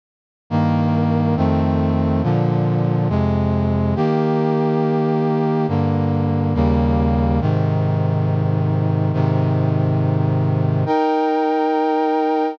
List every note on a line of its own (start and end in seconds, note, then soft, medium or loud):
0.50 1.36 G2 medium
0.50 1.36 D#3 medium
0.50 1.36 A#3 medium
1.36 2.22 F2 medium
1.36 2.22 D#3 medium
1.36 2.22 A3 medium
1.36 2.22 C4 medium
2.23 3.08 A#2 medium
2.23 3.08 D3 medium
2.23 3.08 F3 medium
3.09 3.95 F2 medium
3.09 3.95 C3 medium
3.09 3.95 G#3 medium
3.96 5.66 D#3 medium
3.96 5.66 A#3 medium
3.96 5.66 G4 medium
5.68 6.54 G2 medium
5.68 6.54 D3 medium
5.68 6.54 A#3 medium
6.54 7.40 D#2 medium
6.54 7.40 C#3 medium
6.54 7.40 G3 medium
6.54 7.40 A#3 medium
7.41 9.12 G#2 medium
7.41 9.12 C3 medium
7.41 9.12 D#3 medium
9.13 10.84 G#2 medium
9.13 10.84 C3 medium
9.13 10.84 D#3 medium
10.86 12.57 D#4 medium
10.86 12.57 A#4 medium
10.86 12.57 G5 medium